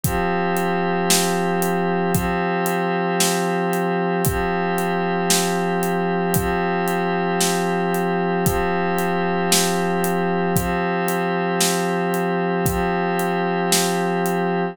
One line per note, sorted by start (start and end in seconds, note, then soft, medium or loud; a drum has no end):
0.04 2.12 F3 loud
0.04 2.12 C4 loud
0.04 2.12 G4 medium
0.04 kick medium
0.04 closed hi-hat medium
0.57 closed hi-hat medium
1.10 snare loud
1.62 closed hi-hat medium
2.14 4.22 F3 loud
2.14 4.22 C4 loud
2.14 4.22 G4 medium
2.14 kick medium
2.14 closed hi-hat medium
2.66 closed hi-hat medium
3.20 snare loud
3.73 closed hi-hat medium
4.25 6.34 F3 loud
4.25 6.34 C4 medium
4.25 6.34 G4 medium
4.25 kick loud
4.25 closed hi-hat medium
4.78 closed hi-hat medium
5.30 snare loud
5.83 closed hi-hat medium
6.34 8.45 F3 loud
6.34 8.45 C4 medium
6.34 8.45 G4 medium
6.34 kick medium
6.34 closed hi-hat loud
6.88 closed hi-hat medium
7.40 snare medium
7.94 closed hi-hat medium
8.45 10.54 F3 loud
8.45 10.54 C4 loud
8.45 10.54 G4 medium
8.45 kick medium
8.45 closed hi-hat medium
8.99 closed hi-hat medium
9.52 snare loud
10.04 closed hi-hat medium
10.56 12.66 F3 loud
10.56 12.66 C4 loud
10.56 12.66 G4 medium
10.56 kick medium
10.56 closed hi-hat medium
11.08 closed hi-hat medium
11.61 snare loud
12.14 closed hi-hat medium
12.66 14.75 F3 loud
12.66 14.75 C4 medium
12.66 14.75 G4 medium
12.66 kick loud
12.66 closed hi-hat medium
13.19 closed hi-hat medium
13.72 snare loud
14.26 closed hi-hat medium